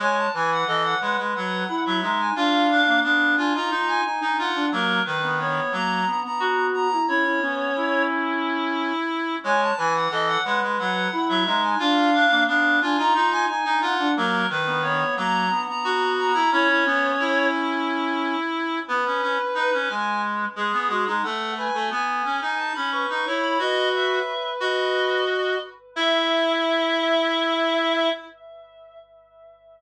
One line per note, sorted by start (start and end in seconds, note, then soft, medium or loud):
0.00 0.27 G#3 medium
0.00 0.29 C#5 medium
0.00 0.17 G#5 loud
0.17 0.33 A5 loud
0.34 0.64 E3 medium
0.34 0.62 B4 medium
0.34 0.50 G#5 loud
0.52 0.68 F#5 medium
0.67 0.95 E3 medium
0.67 0.95 A4 medium
0.67 0.83 D#5 loud
0.84 1.00 F#5 loud
1.01 1.17 G#3 medium
1.01 1.63 B4 medium
1.01 1.17 F#5 medium
1.17 1.33 G#3 medium
1.34 1.64 F#3 medium
1.34 1.81 F#5 medium
1.69 1.99 E4 medium
1.85 2.02 F#3 medium
1.85 2.17 E5 medium
2.02 2.30 G#3 medium
2.02 2.32 D#4 medium
2.19 2.35 G#5 medium
2.36 2.82 D4 medium
2.36 2.67 F4 medium
2.36 2.99 F5 loud
2.70 3.00 D4 medium
2.87 3.03 A#3 medium
3.03 3.35 B3 medium
3.03 3.36 D4 medium
3.03 3.33 F5 medium
3.37 3.53 D4 medium
3.37 3.53 F4 medium
3.37 3.53 G#5 medium
3.54 3.70 D#4 medium
3.54 3.71 F4 medium
3.54 3.87 A#5 medium
3.70 4.01 D#4 medium
3.70 4.04 F4 medium
3.87 4.03 G#5 loud
4.04 4.21 D#4 medium
4.04 4.36 G#5 medium
4.21 4.49 D#4 medium
4.21 4.37 D#4 medium
4.38 4.66 F4 medium
4.38 4.68 F#5 medium
4.55 4.71 D4 medium
4.71 5.01 F#3 medium
4.71 5.00 A#3 medium
4.71 5.02 A#4 loud
5.05 5.60 D#3 medium
5.05 5.36 B4 loud
5.23 5.39 B3 medium
5.39 5.72 B3 medium
5.39 5.72 C#5 loud
5.72 6.05 F#3 medium
5.72 6.01 A#3 medium
5.72 6.20 A#5 medium
6.07 6.23 B3 medium
6.24 6.95 B3 medium
6.24 6.66 A#5 medium
6.40 6.88 F#4 medium
6.74 7.06 A#5 loud
6.92 7.08 E4 medium
7.08 7.40 C#4 medium
7.08 7.24 E4 medium
7.08 8.03 C#5 loud
7.25 7.41 E4 medium
7.41 7.68 B3 medium
7.41 8.93 C#4 medium
7.76 9.36 E4 medium
9.44 9.71 G#3 medium
9.44 9.73 C#5 medium
9.44 9.60 G#5 loud
9.62 9.78 A5 loud
9.77 10.08 E3 medium
9.77 10.05 B4 medium
9.77 9.93 G#5 loud
9.95 10.11 F#5 medium
10.10 10.37 E3 medium
10.10 10.39 A4 loud
10.10 10.28 D#5 loud
10.27 10.43 F#5 loud
10.44 10.61 G#3 medium
10.44 11.07 B4 medium
10.44 10.60 F#5 loud
10.62 10.78 G#3 medium
10.78 11.08 F#3 medium
10.78 11.25 F#5 medium
11.12 11.43 E4 medium
11.28 11.45 F#3 medium
11.28 11.60 E5 loud
11.46 11.74 G#3 medium
11.46 11.76 D#4 medium
11.63 11.79 G#5 medium
11.79 12.26 D4 medium
11.79 12.10 F4 medium
11.79 12.43 F5 loud
12.14 12.44 D4 medium
12.30 12.46 A#3 medium
12.47 12.79 B3 medium
12.47 12.80 D4 medium
12.47 12.77 F5 loud
12.81 12.97 D4 medium
12.81 12.97 F4 medium
12.81 12.98 G#5 loud
12.97 13.14 D#4 loud
12.97 13.13 F4 medium
12.97 13.31 A#5 medium
13.15 13.46 D#4 medium
13.15 13.47 F4 medium
13.32 13.46 G#5 loud
13.47 13.64 D#4 medium
13.47 13.79 G#5 loud
13.65 13.81 D#4 medium
13.65 13.93 D#4 medium
13.81 14.08 F4 medium
13.81 14.11 F#5 loud
13.99 14.15 D4 medium
14.16 14.46 F#3 medium
14.16 14.44 A#3 medium
14.16 14.46 A#4 loud
14.50 15.04 D#3 medium
14.50 14.81 B4 loud
14.66 14.82 B3 medium
14.82 15.16 B3 medium
14.82 15.14 C#5 loud
15.17 15.50 F#3 medium
15.17 15.45 A#3 medium
15.17 15.64 A#5 loud
15.50 15.66 B3 medium
15.67 16.39 B3 medium
15.67 16.10 A#5 loud
15.84 16.32 F#4 medium
16.18 16.50 A#5 loud
16.34 16.50 E4 medium
16.51 16.84 C#4 medium
16.51 16.68 E4 loud
16.51 17.46 C#5 loud
16.69 16.85 E4 medium
16.85 17.12 B3 medium
16.85 18.36 C#4 medium
17.19 18.80 E4 medium
18.88 19.04 B3 medium
18.88 19.74 B4 loud
19.05 19.21 C#4 medium
19.22 19.38 C#4 medium
19.54 19.71 D#4 medium
19.54 19.90 B4 loud
19.73 19.89 C#4 medium
19.88 20.45 G#3 medium
19.88 20.21 G#5 medium
20.56 20.72 G#3 medium
20.56 21.12 G#4 medium
20.56 20.88 G#4 medium
20.72 20.88 B3 medium
20.89 21.05 G#3 medium
20.89 21.06 F#4 medium
21.06 21.22 G#3 medium
21.06 21.23 D#4 medium
21.23 21.68 A3 medium
21.23 21.54 A4 medium
21.23 21.52 F#5 loud
21.57 21.73 B4 medium
21.57 21.87 G#5 medium
21.74 21.90 A3 medium
21.74 21.90 A4 medium
21.90 22.23 B3 medium
21.90 22.57 G#5 medium
22.24 22.40 C#4 medium
22.41 22.73 D#4 medium
22.57 22.73 A5 medium
22.74 23.06 C#4 medium
22.74 22.90 B5 loud
22.91 23.25 B4 medium
22.91 23.12 C#6 medium
23.09 23.25 D#4 medium
23.15 23.36 C#6 medium
23.26 23.58 E4 medium
23.26 23.58 C#5 medium
23.39 23.60 B5 loud
23.58 24.19 F#4 medium
23.58 25.20 B4 medium
23.58 23.88 D#5 loud
23.93 24.49 E5 medium
24.60 25.56 F#4 medium
24.60 25.59 D#5 medium
25.96 28.10 E4 loud
25.96 28.09 E5 loud